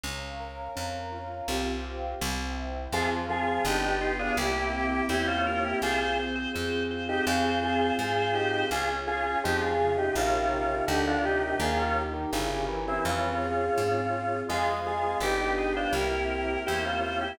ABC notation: X:1
M:4/4
L:1/16
Q:1/4=83
K:Fm
V:1 name="Drawbar Organ"
z16 | [FA] z [FA]2 [EG] [EG]2 [=DF] [=EG]4 [EG] [_DF] [DF] [EG] | [FA] [FA] z5 [EG] [FA]2 [FA]2 [FA]2 [EG]2 | [FA] z [FA]2 [EG] [FA]2 [EG] [DF]4 [EG] [=DF] [EG] [EG] |
[FA] [DF] z5 [C=E] [DF]8 | [FA] z [FA]2 [EG] [EG]2 [=DF] [=EG]4 [EG] [_DF] [DF] [EG] |]
V:2 name="Drawbar Organ"
z16 | F,2 F, F, =D2 F A G2 G G c2 B2 | c2 c c c2 c c c2 c c c2 c2 | D2 D D F,2 D, C, C,2 C, C, =D,2 C,2 |
E,3 E, D,2 =E, E,3 z6 | A,2 A, A, G2 A c B2 B B c2 c2 |]
V:3 name="Acoustic Grand Piano"
D2 B2 D2 F2 [CFG]4 C2 =E2 | [CFA]4 =B,2 G2 _B,2 C2 =E2 G2 | C2 A2 C2 F2 C2 A2 C2 F2 | D2 A2 D2 F2 [EFB]4 =D2 B2 |
E2 G2 [D=EGB]4 C2 A2 C2 F2 | [cfa]4 =B2 g2 _B2 c2 =e2 g2 |]
V:4 name="Electric Bass (finger)" clef=bass
D,,4 F,,4 C,,4 C,,4 | F,,4 G,,,4 C,,4 =E,,4 | C,,4 F,,4 F,,4 A,,4 | D,,4 F,,4 B,,,4 =D,,4 |
E,,4 G,,,4 F,,4 A,,4 | F,,4 G,,,4 C,,4 =E,,4 |]
V:5 name="Pad 2 (warm)"
[dfb]8 [cfg]4 [c=eg]4 | [CFA]4 [=B,=DG]4 [_B,C=EG]8 | [CFA]8 [CFA]8 | [DFA]8 [EFB]4 [=DFB]4 |
[EGB]4 [D=EGB]4 [CFA]8 | [CFA]4 [=B,=DG]4 [_B,C=EG]8 |]